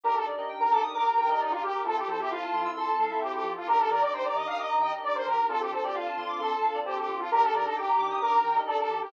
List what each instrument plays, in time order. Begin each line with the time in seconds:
0.04 synth bass 2 G1, lead 2 (sawtooth) D4 D#4 G4 A#4, string ensemble 1 D4 D#4 G4 A#4, electric piano 2 G4
0.15 lead 2 (sawtooth) A4, electric piano 2 A#4
0.25 synth bass 2 G2, lead 2 (sawtooth) D4 D#4 G4 A#4, electric piano 2 D5
0.37 lead 2 (sawtooth) D4 D#4 G4 A#4, electric piano 2 D#5
0.49 synth bass 2 G1, electric piano 2 G5
0.60 lead 2 (sawtooth) A#4, electric piano 2 A#5
0.71 synth bass 2 G2, lead 2 (sawtooth) D4 D#4 G4 A4 A#4, electric piano 2 D6
0.83 electric piano 2 D#6
0.94 synth bass 2 G1, lead 2 (sawtooth) A#4, electric piano 2 D6
1.06 electric piano 2 A#5
1.17 synth bass 2 G2, lead 2 (sawtooth) A#4, electric piano 2 G5
1.29 lead 2 (sawtooth) D4 D#4 G4 A#4, electric piano 2 D#5
1.40 synth bass 2 G1, lead 2 (sawtooth) D#4, electric piano 2 D5
1.51 lead 2 (sawtooth) F4, electric piano 2 A#4
1.62 synth bass 2 G2, electric piano 2 G4, lead 2 (sawtooth) G4
1.74 electric piano 2 A#4
1.84 synth bass 2 F2, lead 2 (sawtooth) C4 E4 F4 A4, string ensemble 1 C4 E4 F4 A4, electric piano 2 F4
1.97 lead 2 (sawtooth) G4, electric piano 2 A4
2.08 synth bass 2 F3, lead 2 (sawtooth) C4 E4 F4 A4, electric piano 2 C5
2.19 lead 2 (sawtooth) C4 E4 F4 G4 A4, electric piano 2 E5
2.30 synth bass 2 F2, lead 2 (sawtooth) F4, electric piano 2 F5
2.42 electric piano 2 A5
2.53 synth bass 2 F3, lead 2 (sawtooth) C4 E4 F4 A4, electric piano 2 C6
2.65 electric piano 2 E6
2.76 synth bass 2 F2, lead 2 (sawtooth) A4, electric piano 2 C6
2.87 electric piano 2 A5
2.99 synth bass 2 F#3, electric piano 2 F5
3.10 lead 2 (sawtooth) C4 E4 F4 A4, electric piano 2 E5
3.21 synth bass 2 F2, lead 2 (sawtooth) G4, electric piano 2 C5
3.33 lead 2 (sawtooth) G4, electric piano 2 A4
3.44 synth bass 2 F3, electric piano 2 F4
3.56 lead 2 (sawtooth) F4, electric piano 2 A4
3.67 synth bass 2 D#2, string ensemble 1 D4 D#4 G4 A#4, lead 2 (sawtooth) D4 D#4 G4 A#4, electric piano 2 G4
3.78 lead 2 (sawtooth) A4, electric piano 2 A#4
3.90 synth bass 2 D#3, lead 2 (sawtooth) D4 D#4 G4 A#4, electric piano 2 D5
4.01 lead 2 (sawtooth) D4 D#4 G4 A#4 D5, electric piano 2 D#5
4.13 synth bass 2 D#2, lead 2 (sawtooth) C5, electric piano 2 G5
4.24 lead 2 (sawtooth) D5, electric piano 2 A#5
4.34 synth bass 2 D#3, lead 2 (sawtooth) D4 D#4 G4 A#4 D#5, electric piano 2 D6
4.47 lead 2 (sawtooth) F5, electric piano 2 D#6
4.58 synth bass 2 D#2, lead 2 (sawtooth) D#5, electric piano 2 D6
4.69 electric piano 2 A#5
4.80 synth bass 2 D#3, lead 2 (sawtooth) D#5, electric piano 2 G5
4.92 lead 2 (sawtooth) D4 D#4 G4 A#4, electric piano 2 D#5
5.03 synth bass 2 D#2, electric piano 2 D5, lead 2 (sawtooth) D5
5.15 electric piano 2 A#4, lead 2 (sawtooth) C5
5.26 synth bass 2 D#3, electric piano 2 G4, lead 2 (sawtooth) A#4
5.38 electric piano 2 A#4
5.48 synth bass 2 D2, lead 2 (sawtooth) C4 D4 F4 A4, string ensemble 1 C4 D4 F4 A4, electric piano 2 F4
5.60 lead 2 (sawtooth) G4, electric piano 2 A4
5.71 synth bass 2 D3, lead 2 (sawtooth) C4 D4 F4 A4, electric piano 2 C5
5.82 lead 2 (sawtooth) C4 D4 F4 G4 A4, electric piano 2 D5
5.94 synth bass 2 D2, lead 2 (sawtooth) F4, electric piano 2 F5
6.06 electric piano 2 A5
6.17 synth bass 2 D3, lead 2 (sawtooth) C4 D4 F4 A4, electric piano 2 C6
6.29 electric piano 2 D6
6.39 synth bass 2 D2, lead 2 (sawtooth) A4, electric piano 2 C6
6.51 electric piano 2 A5
6.62 synth bass 2 D3, electric piano 2 F5
6.74 lead 2 (sawtooth) C4 D4 F4 A4, electric piano 2 D5
6.85 synth bass 2 D2, lead 2 (sawtooth) G4, electric piano 2 C5
6.97 lead 2 (sawtooth) G4, electric piano 2 A4
7.08 synth bass 2 D3, electric piano 2 F4
7.19 lead 2 (sawtooth) F4, electric piano 2 A4
7.31 synth bass 2 D#2, string ensemble 1 D4 D#4 G4 A#4, lead 2 (sawtooth) D4 D#4 G4 A#4, electric piano 2 G4
7.42 lead 2 (sawtooth) A4, electric piano 2 A#4
7.53 synth bass 2 D#3, lead 2 (sawtooth) D4 D#4 G4 A#4, electric piano 2 D5
7.64 lead 2 (sawtooth) D4 D#4 G4 A4 A#4, electric piano 2 D#5
7.76 synth bass 2 D#2, lead 2 (sawtooth) G4, electric piano 2 G5
7.88 electric piano 2 A#5
7.97 synth bass 2 D#3, lead 2 (sawtooth) D4 D#4 G4 A#4, electric piano 2 D6
8.10 electric piano 2 D#6
8.21 synth bass 2 D#2, lead 2 (sawtooth) A#4, electric piano 2 D6
8.33 electric piano 2 A#5
8.44 synth bass 2 D#3, electric piano 2 G5
8.54 lead 2 (sawtooth) D4 D#4 G4 A#4, electric piano 2 D#5
8.67 synth bass 2 D#2, lead 2 (sawtooth) A4, electric piano 2 D5
8.79 lead 2 (sawtooth) A4, electric piano 2 A#4
8.89 synth bass 2 D#3, electric piano 2 G4
9.01 lead 2 (sawtooth) G4, electric piano 2 A#4